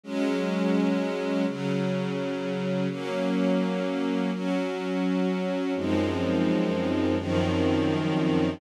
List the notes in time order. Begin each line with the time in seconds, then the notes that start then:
0.04 F#3 G#3 C#4
1.46 C#3 F#3 C#4
2.89 F#3 A#3 C#4
4.32 F#3 C#4 F#4
5.75 F#2 F3 G#3 C4 D#4
7.18 F#2 D#3 F3 C4 D#4